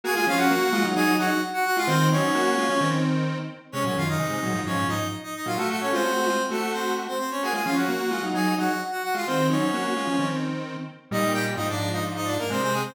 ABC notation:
X:1
M:4/4
L:1/16
Q:1/4=130
K:Db
V:1 name="Lead 1 (square)"
[Aa] [Aa] [Ff] [Gg]5 [Aa]2 [Gg]2 z [Gg] [Gg] [Ff] | [Cc]2 [Dd]8 z6 | [Dd] [Dd] [Ff] [Ee]5 [Dd]2 [Ee]2 z [Ee] [Ee] [Ff] | [=A,=A] [A,A] [Dd] [Cc]5 [A,A]2 [Cc]2 z [Cc] [Cc] [Dd] |
[Aa] [Aa] [Ff] [Gg]5 [Aa]2 [Gg]2 z [Gg] [Gg] [Ff] | [Cc]2 [Dd]8 z6 | [K:Eb] [Ee]2 [Gg] z [Ee] [Dd]2 [Ee] z [Ee] [Dd] [B,B] [Cc] [Cc] [A,A] [Cc] |]
V:2 name="Lead 1 (square)"
[B,G] [A,F] [F,D]2 [B,G]2 [A,F] [G,E] [G,E]2 [G,E] z4 [A,F] | [E,C]2 [G,E]2 [B,G]2 [A,F] [F,D] [E,C]6 z2 | [C,A,] [B,,G,] [G,,E,]2 [C,A,]2 [B,,G,] [A,,F,] [A,,F,]2 [A,,F,] z4 [B,,G,] | [=A,G]3 [_A,F] [=A,G] [A,G] [_A,F] z [=A,G]6 z2 |
[B,G] [A,F] [F,D]2 [B,G]2 [A,F] [G,E] [G,E]2 [G,E] z4 [A,F] | [E,C]2 [G,E]2 [B,G]2 [A,F] [F,D] [E,C]6 z2 | [K:Eb] [B,,G,]4 [A,,F,]8 [C,A,]4 |]